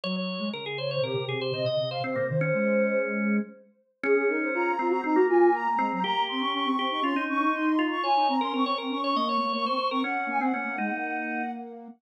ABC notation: X:1
M:4/4
L:1/16
Q:1/4=120
K:Db
V:1 name="Ocarina"
z6 d c =G4 e3 f | c2 c6 z8 | A2 B c b3 b b2 a2 b3 b | b2 c' d' d'3 d' c'2 d'2 c'3 d' |
a2 b c' d'3 d' d'2 d'2 d'3 d' | g2 a g9 z4 |]
V:2 name="Drawbar Organ"
d d3 B A c d B2 A c c e2 c | C B, z D9 z4 | D6 C2 C B,5 C2 | =G6 G2 F E5 F2 |
d3 B B d B2 d e d2 d c c B | D3 C D2 E6 z4 |]
V:3 name="Ocarina"
G,3 A, D,4 C, C, C,2 C, C, C,2 | C, C, E,2 A,8 z4 | D D E2 F2 F G E G F2 B,2 A, G, | B, B, C D D C C E D D D E5 |
F E C D C C C D D B,2 B, B, C z C | D2 B, C B, B, A, B,9 |]